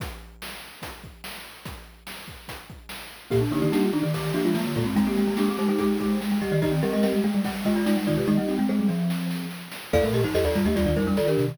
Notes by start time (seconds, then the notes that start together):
0.00 kick, closed hi-hat
0.42 snare
0.82 kick, closed hi-hat
1.04 kick
1.24 snare
1.65 kick, closed hi-hat
2.07 snare
2.28 kick
2.48 kick, closed hi-hat
2.70 kick
2.89 snare
3.30 A#2 A#3 G4, kick, crash
3.41 D4
3.51 D3 A#3 D#4 G4, snare, ride
3.62 D#3 A#3 D#4 G4
3.72 G3 A#3 D4 D#4 G4, snare
3.83 F4
3.93 D#3 D4 D#4, ride
4.03 D#3 G4
4.14 D#3 G4, kick, ride
4.34 F3 A#3 D4 F4 G4, ride
4.45 G#3 F4
4.55 F3 G#3 A#3 F4, snare
4.66 D3
4.75 A#2 G#3 A#3 F4, kick, ride
4.86 G2 C4
4.96 G#3 C4 D#4, kick, ride
5.07 A#3 C4 G4
5.16 G#3, snare, ride
5.27 G#3 A#3
5.37 G#3 A#3 D4 G4, snare
5.48 C4 G4 G#4
5.58 G#3 D#4 G4 C5, ride
5.68 G#3 D#4 G4
5.78 G#3 G4 G#4, kick, ride
6.00 G#3 G4, kick, ride
6.21 G#3, snare
6.32 G#3
6.41 G3 G4 D#5, kick, ride
6.52 D#3 G4 D#5
6.62 D#3 D#4 G4 D#5, kick, ride
6.72 C4
6.83 G3 G4 A#4 D#5, snare, ride
6.93 G#3 G4 A#4 D#5
7.03 G3 C4 G4 A#4 D#5, snare
7.13 G#3
7.24 G#3 A#3 G#4, ride
7.34 G3 G#3
7.44 G3, kick, ride
7.65 G#3 F4 G4 D#5, kick, ride
7.76 F4 D5
7.86 G#3 D#4 F4 D5, snare
7.97 G3
8.07 D#3 D#4 F4 D5, kick, ride
8.17 C3 G4
8.27 D#3 G#3 D#4 G4 D#5, kick, snare
8.37 G3 A#3
8.48 C4 D#4, snare
8.58 G#3 C4
8.69 G#3 C4 G#4 C5
8.79 G3
8.88 F3, snare
9.10 snare
9.31 snare
9.51 snare
9.71 snare
9.93 F2 A#3 A4 D5 F5, kick, crash
10.03 A2 A3 A#4, closed hi-hat
10.13 A#2 G4 D#5, closed hi-hat
10.23 G2 F3 D#4 C5, closed hi-hat
10.34 F2 G4 A4 D#5, snare
10.44 D#2 F4 A4 D5, closed hi-hat
10.55 G2 G3 F4 D5, closed hi-hat
10.65 D#2 A3 G4 D#5, closed hi-hat
10.76 D#2 G3 F4 D5, kick, closed hi-hat
10.86 D#2 D#3 F4 D5, closed hi-hat
10.96 F2 G3 D#4 A#4 C5, kick, closed hi-hat
11.06 G3 D4 A#4, closed hi-hat
11.17 D#3 F4 A4 D5, snare
11.27 D4 G4 A#4, closed hi-hat
11.38 C3 D#3, closed hi-hat
11.48 C3, closed hi-hat